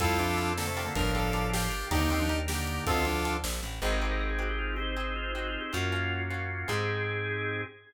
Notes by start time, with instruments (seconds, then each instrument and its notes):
0.00 electric bass (finger) F2, drawbar organ G3 C4 E4 F4 A4, pizzicato strings C4 E4 F4 A4, lead 2 (sawtooth) F4 A4, kick, closed hi-hat
0.19 drawbar organ F3 D4, pizzicato strings C4 E4 F4 A4, closed hi-hat
0.37 pizzicato strings C4 E4 F4 A4, closed hi-hat
0.57 drawbar organ D3 A#3, lead 2 (sawtooth) A4, snare
0.67 drawbar organ C3 A3
0.77 pizzicato strings D4 F4 G4 A#4, open hi-hat
0.86 drawbar organ D3 A#3
0.95 electric bass (finger) G1, drawbar organ A2 F3 D4 F4 G4 A#4, lead 2 (sawtooth) A#4, kick, closed hi-hat
1.15 pizzicato strings D4 F4 G4 A#4, lead 2 (sawtooth) A4, closed hi-hat
1.33 pizzicato strings D4 F4 G4 A#4, closed hi-hat
1.53 lead 2 (sawtooth) G4, snare
1.72 closed hi-hat
1.91 electric bass (finger) D#2, drawbar organ D3 A#3 D4 D#4 G4 A#4, pizzicato strings D4 D#4 G4 A#4, lead 2 (sawtooth) D#4 G4, kick, closed hi-hat
2.01 drawbar organ D3 A#3
2.10 drawbar organ D#3 C4, pizzicato strings D4 D#4 G4 A#4, closed hi-hat
2.20 drawbar organ F3 D4
2.29 pizzicato strings D4 D#4 G4 A#4, closed hi-hat
2.48 drawbar organ D3 A#3, lead 2 (sawtooth) G4, snare
2.67 closed hi-hat
2.86 electric bass (finger) D2, drawbar organ D#3 C4, pizzicato strings C4 D4 F4 A4, lead 2 (sawtooth) F4 A4, kick, closed hi-hat
3.05 drawbar organ F3 D4, pizzicato strings C4 D4 F4 A4, closed hi-hat
3.25 pizzicato strings C4 D4 F4 A4, closed hi-hat
3.44 electric bass (finger) A#1, snare
3.63 electric bass (finger) A1, closed hi-hat
3.82 electric bass (finger) G#1, drawbar organ C4 D#4 G4 G#4, pizzicato strings C4 D#4 G4 G#4
3.92 drawbar organ A#4
4.02 pizzicato strings C4 D#4 G4 G#4
4.11 drawbar organ A#4
4.20 drawbar organ A#4
4.30 drawbar organ G#4
4.39 pizzicato strings C4 D#4 G4 G#4, drawbar organ F#4
4.49 drawbar organ G4
4.59 drawbar organ F4
4.76 drawbar organ C4 D#4 G4 G#4 C5
4.96 pizzicato strings C4 D#4 G4 G#4, drawbar organ D#4
5.16 drawbar organ F4
5.35 pizzicato strings C4 D#4 G4 G#4, drawbar organ F#4
5.48 drawbar organ F4
5.61 drawbar organ G4
5.73 electric bass (finger) F#2, pizzicato strings A#3 C#4 F4 F#4, drawbar organ A#3 C#4 F4 F#4
5.92 pizzicato strings A#3 C#4 F4 F#4
6.30 pizzicato strings A#3 C#4 F4 F#4
6.68 electric bass (finger) G#2, pizzicato strings C4 D#4 G4 G#4, drawbar organ C4 D#4 G4 G#4